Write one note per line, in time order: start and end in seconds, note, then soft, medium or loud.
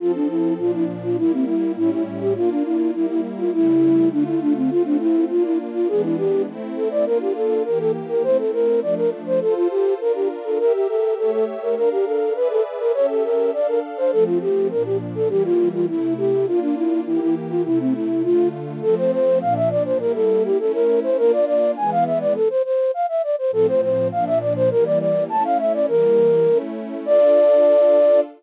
0.00 0.58 F3 medium
0.00 0.59 C4 medium
0.00 0.12 F4 medium
0.00 0.59 A4 medium
0.15 0.28 D4 medium
0.29 0.54 E4 medium
0.58 1.16 A#2 medium
0.58 1.16 F3 medium
0.58 1.16 D4 medium
0.58 0.71 F4 medium
0.74 0.85 E4 medium
1.03 1.17 F4 medium
1.18 1.76 G3 medium
1.18 1.76 A#3 medium
1.18 1.32 E4 medium
1.18 1.76 E4 medium
1.33 1.45 C4 medium
1.47 1.72 E4 medium
1.76 2.34 A2 medium
1.76 2.34 G3 medium
1.76 2.34 C#4 medium
1.76 2.34 E4 medium
1.76 1.91 E4 medium
1.91 2.03 E4 medium
2.21 2.33 G4 medium
2.35 2.93 A#3 medium
2.35 2.93 D4 medium
2.35 2.93 F4 medium
2.35 2.50 F4 medium
2.50 2.63 D4 medium
2.65 2.91 E4 medium
2.94 3.52 G3 medium
2.94 3.52 A#3 medium
2.94 3.52 E4 medium
2.94 3.06 E4 medium
3.09 3.21 E4 medium
3.38 3.52 F4 medium
3.53 4.12 C#3 medium
3.53 4.12 G3 medium
3.53 4.12 A3 medium
3.53 4.09 E4 medium
3.53 4.12 E4 medium
4.12 4.71 D3 medium
4.12 4.71 A3 medium
4.12 4.24 D4 medium
4.12 4.71 F4 medium
4.27 4.40 E4 medium
4.41 4.53 D4 medium
4.56 4.70 C4 medium
4.71 5.30 A3 medium
4.71 5.30 C4 medium
4.71 4.83 F4 medium
4.71 5.30 F4 medium
4.85 4.97 D4 medium
5.00 5.25 E4 medium
5.29 5.89 A#3 medium
5.29 5.88 D4 medium
5.29 5.43 F4 medium
5.29 5.89 F4 medium
5.44 5.58 E4 medium
5.74 5.88 F4 medium
5.88 6.46 E3 medium
5.88 6.46 G#3 medium
5.88 6.46 B3 medium
5.88 6.46 D4 medium
5.88 6.02 G#4 medium
6.03 6.16 E4 medium
6.18 6.42 G4 medium
6.47 7.06 A3 medium
6.47 7.06 C4 medium
6.47 7.06 E4 loud
6.76 6.89 A4 medium
6.91 7.05 D5 medium
7.06 7.64 A#3 medium
7.06 7.64 D4 medium
7.06 7.64 F4 medium
7.06 7.18 A#4 medium
7.21 7.33 G4 medium
7.35 7.63 A4 medium
7.65 8.24 E3 medium
7.65 8.24 A#3 medium
7.65 8.24 G4 medium
7.65 7.79 A#4 medium
7.80 7.91 A4 medium
8.09 8.23 A#4 medium
8.23 8.81 A3 medium
8.23 8.81 C4 medium
8.23 8.81 E4 medium
8.23 8.37 C5 medium
8.38 8.51 A4 medium
8.53 8.80 A#4 medium
8.82 9.40 F3 medium
8.82 9.40 A3 medium
8.82 9.40 D4 medium
8.82 8.94 D5 medium
8.97 9.10 A#4 medium
9.26 9.40 C5 medium
9.41 9.99 F4 medium
9.41 9.54 A4 medium
9.41 9.99 A4 medium
9.41 9.99 C5 medium
9.56 9.68 F4 medium
9.70 9.94 G4 medium
10.00 10.59 D4 medium
10.00 10.59 F4 medium
10.00 10.12 A#4 medium
10.00 10.59 A#4 medium
10.15 10.28 G4 medium
10.44 10.58 A4 medium
10.59 11.16 G4 medium
10.59 10.73 A#4 medium
10.59 11.17 A#4 medium
10.59 11.16 E5 medium
10.73 10.87 G4 medium
10.88 11.14 A4 medium
11.17 11.75 A3 medium
11.17 11.75 G4 medium
11.17 11.31 A4 medium
11.17 11.75 C#5 medium
11.17 11.75 E5 medium
11.32 11.45 A4 medium
11.62 11.75 A#4 medium
11.75 12.34 D4 medium
11.75 12.34 A#4 medium
11.75 11.89 A#4 medium
11.75 12.34 F5 medium
11.91 12.05 G4 medium
12.06 12.33 A4 medium
12.34 12.92 G#4 medium
12.34 12.92 B4 loud
12.34 12.48 B4 medium
12.34 12.92 D5 medium
12.34 12.92 E5 medium
12.50 12.63 A4 medium
12.80 12.92 A#4 medium
12.94 13.52 C#4 medium
12.94 13.52 G4 medium
12.94 13.52 A4 medium
12.94 13.06 C#5 medium
12.94 13.52 E5 medium
13.09 13.23 A4 medium
13.24 13.51 A#4 medium
13.53 14.12 D4 medium
13.53 14.12 A4 medium
13.53 13.67 D5 medium
13.53 14.12 F5 medium
13.67 13.80 A#4 medium
13.97 14.11 C5 medium
14.12 14.70 F3 medium
14.12 14.70 A3 medium
14.12 14.70 C4 medium
14.12 14.24 A4 medium
14.26 14.38 F4 medium
14.41 14.68 G4 medium
14.71 15.29 A#2 medium
14.71 15.29 F3 medium
14.71 15.29 D4 medium
14.71 14.83 A#4 medium
14.85 14.97 G4 medium
15.15 15.28 A4 medium
15.28 15.86 E3 medium
15.28 15.86 G3 medium
15.28 15.86 A#3 medium
15.28 15.43 G4 medium
15.44 15.69 F4 medium
15.73 15.86 F4 medium
15.87 16.45 C3 medium
15.87 16.45 A3 medium
15.87 16.45 E4 medium
15.87 16.14 E4 medium
16.17 16.46 G4 medium
16.46 17.04 A#3 medium
16.46 17.04 D4 medium
16.46 17.04 F4 medium
16.46 16.60 F4 medium
16.61 16.75 D4 medium
16.76 17.00 E4 medium
17.06 17.64 E3 medium
17.06 17.64 A#3 medium
17.06 17.20 E4 medium
17.06 17.64 G4 medium
17.21 17.35 E4 medium
17.50 17.63 F4 medium
17.64 18.23 C3 medium
17.64 18.22 A3 medium
17.64 18.23 E4 medium
17.64 17.79 E4 medium
17.79 17.94 C4 medium
17.94 18.23 E4 medium
18.23 18.81 D3 medium
18.23 18.81 A3 medium
18.23 18.81 F4 medium
18.23 18.48 F4 medium
18.82 19.41 F3 medium
18.82 19.41 A3 medium
18.82 19.41 C4 loud
18.82 18.95 A4 medium
18.97 19.11 C5 medium
19.12 19.39 C5 medium
19.41 20.00 A#2 loud
19.41 20.00 F3 medium
19.41 20.00 D4 medium
19.41 19.54 F5 medium
19.56 19.69 E5 medium
19.71 19.83 D5 medium
19.85 19.98 C5 medium
19.99 20.58 G3 medium
19.99 20.58 A#3 medium
19.99 20.58 E4 medium
19.99 20.12 A#4 medium
20.15 20.43 A4 medium
20.44 20.58 G4 medium
20.59 21.18 A3 medium
20.59 21.18 C#4 medium
20.59 21.18 E4 medium
20.59 20.72 A4 medium
20.74 21.00 A#4 medium
21.03 21.17 C5 medium
21.17 21.75 A#3 medium
21.17 21.75 D4 medium
21.17 21.75 F4 medium
21.17 21.32 A#4 medium
21.33 21.45 D5 medium
21.47 21.71 D5 medium
21.77 22.35 E3 medium
21.77 22.35 G#3 medium
21.77 22.35 B3 loud
21.77 21.90 G#5 medium
21.91 22.04 F5 medium
22.06 22.19 E5 medium
22.20 22.33 D5 medium
22.35 22.49 A4 medium
22.50 22.62 C5 medium
22.65 22.91 C5 medium
22.94 23.06 F5 medium
23.09 23.22 E5 medium
23.23 23.36 D5 medium
23.38 23.51 C5 medium
23.51 24.10 A2 medium
23.51 24.10 F3 medium
23.51 24.10 C4 medium
23.51 23.67 A4 medium
23.68 23.81 C5 medium
23.82 24.08 C5 medium
24.12 24.70 A#2 loud
24.12 24.70 F3 medium
24.12 24.70 D4 medium
24.12 24.25 F5 medium
24.27 24.39 E5 medium
24.41 24.53 D5 medium
24.56 24.70 C5 medium
24.71 25.29 E3 loud
24.71 25.29 G3 medium
24.71 25.29 A#3 medium
24.71 24.84 A#4 medium
24.85 24.99 D5 medium
25.00 25.24 D5 medium
25.29 25.87 A3 medium
25.29 25.87 C#4 medium
25.29 25.87 E4 medium
25.29 25.43 A5 medium
25.44 25.58 F5 medium
25.59 25.73 E5 medium
25.74 25.86 D5 medium
25.88 26.47 E3 medium
25.88 26.47 G3 medium
25.88 26.47 A#3 medium
25.88 26.58 A#4 medium
26.48 27.06 A3 medium
26.48 27.06 C#4 medium
26.48 27.06 E4 medium
27.06 28.21 D4 loud
27.06 28.21 F4 loud
27.06 28.21 A4 loud
27.06 28.21 D5 loud